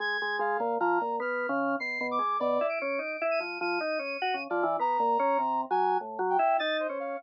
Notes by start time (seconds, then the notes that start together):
0.00 G#3 G#6
0.22 G#3
0.39 G#3 F5
0.60 A#2
0.80 F3 A#5
1.01 A#2
1.20 B3 F6
1.49 C#3
1.80 B2 C7
2.01 B2
2.11 D6
2.19 G#3
2.40 B2 D5
2.61 E4
2.69 D7
2.82 C#4
2.99 D#4
3.21 E4
3.31 D#7
3.40 F3
3.61 F3 D#7
3.81 D#4
3.99 C#4
4.22 F#4
4.34 C#3
4.50 F3 D5
4.63 E3
4.79 B3 A#5
5.00 A#2
5.19 C#4
5.38 C3
5.71 F#3 G#5
6.01 A2
6.19 F#3
6.30 G5
6.39 E4
6.59 D#4 A6
6.80 C5
6.89 C#4
7.00 F5